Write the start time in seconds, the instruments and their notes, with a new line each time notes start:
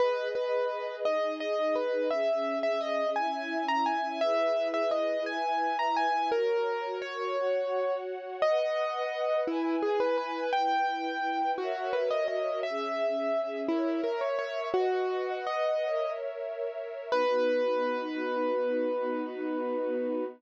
0.00 string ensemble 1 G#4 B4 D#5, acoustic grand piano B4
0.35 acoustic grand piano B4
1.04 string ensemble 1 D#4 G#4 D#5, acoustic grand piano D#5
1.40 acoustic grand piano D#5
1.75 acoustic grand piano B4
2.11 string ensemble 1 C#4 G#4 E5, acoustic grand piano E5
2.63 acoustic grand piano E5
2.81 acoustic grand piano D#5
3.16 string ensemble 1 C#4 E4 E5, acoustic grand piano G#5
3.68 acoustic grand piano A#5
3.86 acoustic grand piano G#5
4.21 string ensemble 1 E4 G#4 B4, acoustic grand piano E5
4.74 acoustic grand piano E5
4.91 acoustic grand piano D#5
5.26 string ensemble 1 E4 B4 E5, acoustic grand piano G#5
5.79 acoustic grand piano A#5
5.96 acoustic grand piano G#5
6.32 string ensemble 1 F#4 A#4 C#5, acoustic grand piano A#4
7.02 acoustic grand piano C#5
7.37 string ensemble 1 F#4 C#5 F#5
8.42 string ensemble 1 B4 D#5 F#5, acoustic grand piano D#5
9.47 acoustic grand piano E4, string ensemble 1 E4 B4 G#5
9.82 acoustic grand piano G#4
10.00 acoustic grand piano B4
10.18 acoustic grand piano B4
10.53 string ensemble 1 E4 B4 G5, acoustic grand piano G5
11.58 acoustic grand piano F#4, string ensemble 1 F#4 A#4 C#5 E5
11.93 acoustic grand piano B4
12.11 acoustic grand piano D#5
12.28 acoustic grand piano D#5
12.63 string ensemble 1 C#4 G#4 E5, acoustic grand piano E5
13.68 acoustic grand piano E4, string ensemble 1 A#4 C#5 E5
14.04 acoustic grand piano A#4
14.21 acoustic grand piano C#5
14.39 acoustic grand piano C#5
14.74 acoustic grand piano F#4, string ensemble 1 B4 D#5 F#5
15.47 acoustic grand piano D#5
15.84 string ensemble 1 A#4 C#5 E5
17.12 string ensemble 1 B3 D#4 F#4, acoustic grand piano B4